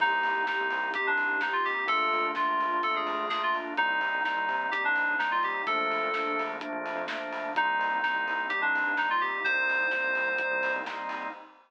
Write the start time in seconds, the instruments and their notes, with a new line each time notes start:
0.00 synth bass 1 C2, pad 2 (warm) A#3 C4 D#4 G4, drawbar organ A#3 C4 D#4 G4, electric piano 2 D#4, kick, crash
0.23 synth bass 1 C2, open hi-hat
0.35 synth bass 1 C2
0.47 drawbar organ A#3 C4 D#4 G4, electric piano 2 D#4, kick, snare
0.61 synth bass 1 C2
0.70 synth bass 1 C2, open hi-hat
0.94 drawbar organ A#3 C4 D#4 G4, electric piano 2 G4, kick, closed hi-hat
1.07 synth bass 1 C2, electric piano 2 D4
1.18 open hi-hat
1.31 synth bass 1 C2
1.41 drawbar organ A#3 C4 D#4 G4, electric piano 2 D#4, kick, snare
1.53 electric piano 2 F4
1.65 electric piano 2 G4, open hi-hat
1.87 synth bass 1 A#1, pad 2 (warm) A3 A#3 D4 F4, drawbar organ A3 A#3 D4 F4, electric piano 2 A4, kick, closed hi-hat
2.13 synth bass 1 F2, open hi-hat
2.24 synth bass 1 A#1
2.35 drawbar organ A3 A#3 D4 F4, electric piano 2 F4, kick, snare
2.49 synth bass 1 A#1
2.61 synth bass 1 A#1, open hi-hat
2.83 drawbar organ A3 A#3 D4 F4, electric piano 2 A4, kick, closed hi-hat
2.94 synth bass 1 F2, electric piano 2 G#4
3.07 open hi-hat
3.19 synth bass 1 A#1
3.29 drawbar organ A3 A#3 D4 F4, electric piano 2 G#4, kick, snare
3.43 electric piano 2 F4
3.55 open hi-hat
3.77 synth bass 1 C2, pad 2 (warm) G3 A#3 C4 D#4, drawbar organ G3 A#3 C4 D#4, electric piano 2 D#4, kick, closed hi-hat
4.01 synth bass 1 C3, open hi-hat
4.15 synth bass 1 C2
4.24 drawbar organ G3 A#3 C4 D#4, electric piano 2 D#4, kick, snare
4.37 synth bass 1 C2
4.48 synth bass 1 C3, open hi-hat
4.71 drawbar organ G3 A#3 C4 D#4, electric piano 2 G4, kick, closed hi-hat
4.83 synth bass 1 C2, electric piano 2 D4
4.96 open hi-hat
5.10 synth bass 1 C2
5.19 drawbar organ G3 A#3 C4 D#4, electric piano 2 D#4, kick, snare
5.31 electric piano 2 F4
5.43 electric piano 2 G4, open hi-hat
5.66 synth bass 1 A#1, drawbar organ F3 A3 A#3 D4, pad 2 (warm) F3 A3 A#3 D4, electric piano 2 A4, kick, closed hi-hat
5.90 synth bass 1 A#1, open hi-hat
6.03 synth bass 1 A#2
6.14 drawbar organ F3 A3 A#3 D4, kick, snare
6.26 synth bass 1 A#1
6.39 synth bass 1 A#1, open hi-hat
6.60 drawbar organ F3 A3 A#3 D4, kick, closed hi-hat
6.72 synth bass 1 A#1
6.86 open hi-hat
6.95 synth bass 1 F2
7.08 drawbar organ F3 A3 A#3 D4, kick, snare
7.33 open hi-hat
7.55 synth bass 1 C2, pad 2 (warm) G3 A#3 C4 D#4, drawbar organ G3 A#3 C4 D#4, electric piano 2 D#4, kick, closed hi-hat
7.79 synth bass 1 C2, open hi-hat
7.91 synth bass 1 C2
8.03 drawbar organ G3 A#3 C4 D#4, electric piano 2 D#4, kick, snare
8.14 synth bass 1 C2
8.27 synth bass 1 C2, open hi-hat
8.49 drawbar organ G3 A#3 C4 D#4, electric piano 2 G4, kick, closed hi-hat
8.61 synth bass 1 C2, electric piano 2 D4
8.75 open hi-hat
8.86 synth bass 1 G2
8.97 drawbar organ G3 A#3 C4 D#4, electric piano 2 D#4, kick, snare
9.10 electric piano 2 F4
9.21 electric piano 2 G4, open hi-hat
9.44 synth bass 1 C2, pad 2 (warm) G3 A#3 C4 D#4, drawbar organ G3 A#3 C4 D#4, electric piano 2 C5, kick, closed hi-hat
9.68 synth bass 1 C2, open hi-hat
9.81 synth bass 1 C2
9.91 drawbar organ G3 A#3 C4 D#4, kick, snare
10.04 synth bass 1 C2
10.15 synth bass 1 C2, open hi-hat
10.38 drawbar organ G3 A#3 C4 D#4, kick, closed hi-hat
10.51 synth bass 1 C2
10.63 open hi-hat
10.76 synth bass 1 C2
10.86 drawbar organ G3 A#3 C4 D#4, kick, snare
11.09 open hi-hat